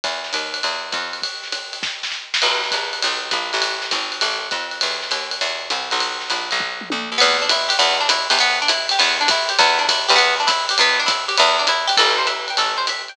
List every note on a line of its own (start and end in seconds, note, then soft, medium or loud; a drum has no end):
0.04 0.32 E2 medium
0.04 kick medium
0.04 ride loud
0.24 snare medium
0.33 0.62 D#2 medium
0.33 hi-hat pedal medium
0.33 ride loud
0.54 ride medium
0.63 0.92 E2 medium
0.63 ride loud
0.92 1.21 F2 medium
0.92 kick medium
0.92 hi-hat pedal medium
0.92 ride medium
1.13 ride medium
1.22 kick medium
1.22 ride loud
1.43 snare medium
1.52 hi-hat pedal medium
1.52 ride loud
1.73 ride medium
1.83 kick medium
1.83 snare loud
2.03 snare medium
2.12 snare medium
2.34 snare loud
2.42 2.70 B1 medium
2.42 crash loud
2.42 ride loud
2.64 snare medium
2.71 3.01 A#1 medium
2.71 kick medium
2.71 hi-hat pedal medium
2.71 ride loud
2.93 ride medium
3.02 3.32 B1 loud
3.02 ride loud
3.31 3.52 A#1 medium
3.31 kick medium
3.31 hi-hat pedal loud
3.31 ride loud
3.53 3.91 A1 loud
3.53 ride medium
3.62 ride loud
3.82 snare medium
3.91 4.20 G#1 medium
3.91 kick medium
3.91 hi-hat pedal loud
3.91 ride loud
4.12 ride medium
4.21 4.50 A1 medium
4.21 ride loud
4.51 4.80 F2 medium
4.51 kick medium
4.51 hi-hat pedal medium
4.51 ride medium
4.71 ride medium
4.81 5.11 E2 medium
4.81 ride loud
5.02 snare medium
5.11 5.40 D#2 medium
5.11 hi-hat pedal medium
5.11 ride loud
5.31 ride loud
5.41 5.69 E2 medium
5.41 ride loud
5.70 5.91 C2 medium
5.70 hi-hat pedal loud
5.70 ride medium
5.91 6.29 B1 medium
5.91 ride medium
6.00 ride loud
6.21 snare medium
6.30 6.50 A#1 medium
6.30 hi-hat pedal loud
6.30 ride loud
6.51 6.89 B1 loud
6.51 ride medium
6.60 kick loud
6.81 mid tom medium
6.90 7.10 D2 medium
6.90 high tom loud
7.12 7.20 D#2 medium
7.18 7.74 E2 loud
7.18 7.37 B3 loud
7.18 ride loud
7.42 7.50 D4 medium
7.49 7.70 E4 medium
7.49 hi-hat pedal loud
7.49 ride loud
7.69 7.77 G4 medium
7.69 ride loud
7.79 8.27 E2 loud
7.79 7.97 B3 loud
7.79 ride loud
8.01 8.09 D4 medium
8.09 8.28 E4 medium
8.09 hi-hat pedal loud
8.09 ride loud
8.30 8.92 E2 loud
8.30 8.38 G4 medium
8.30 ride loud
8.39 8.59 B3 loud
8.39 ride loud
8.62 8.70 D4 medium
8.68 8.87 E4 medium
8.68 hi-hat pedal loud
8.68 ride loud
8.89 9.00 G4 medium
8.89 ride loud
8.99 9.52 E2 loud
8.99 9.17 B3 loud
8.99 ride loud
9.21 9.29 D4 medium
9.28 9.50 E4 medium
9.28 kick loud
9.28 hi-hat pedal loud
9.28 ride loud
9.49 9.58 G4 medium
9.49 ride loud
9.59 10.06 E2 loud
9.59 9.79 B3 medium
9.59 kick medium
9.59 ride loud
9.79 9.87 D4 medium
9.89 10.09 E4 medium
9.89 kick medium
9.89 hi-hat pedal loud
9.89 ride loud
10.08 10.71 E2 loud
10.08 10.17 G4 medium
10.08 ride loud
10.16 10.34 B3 loud
10.16 ride loud
10.40 10.48 D4 medium
10.47 10.66 E4 medium
10.47 kick medium
10.47 hi-hat pedal loud
10.47 ride loud
10.69 10.79 G4 medium
10.69 ride loud
10.78 11.31 E2 loud
10.78 10.99 B3 loud
10.78 ride loud
10.99 11.08 D4 medium
11.06 11.25 E4 medium
11.06 kick medium
11.06 hi-hat pedal loud
11.06 ride loud
11.28 11.36 G4 medium
11.28 ride loud
11.37 11.92 E2 loud
11.37 11.57 B3 medium
11.37 ride loud
11.59 11.67 D4 medium
11.67 11.87 E4 medium
11.67 hi-hat pedal loud
11.67 ride loud
11.87 11.96 G4 medium
11.87 ride loud
11.97 12.51 A1 loud
11.97 12.16 A4 medium
11.97 kick medium
11.97 crash loud
11.97 ride loud
12.18 12.26 C5 medium
12.27 12.46 E5 medium
12.27 hi-hat pedal medium
12.27 ride loud
12.48 12.58 G5 medium
12.48 ride medium
12.57 13.10 A1 medium
12.57 12.77 A4 medium
12.57 ride loud
12.78 12.86 C5 medium
12.87 13.08 E5 medium
12.87 hi-hat pedal loud
12.87 ride loud
13.08 13.16 G5 medium
13.08 ride medium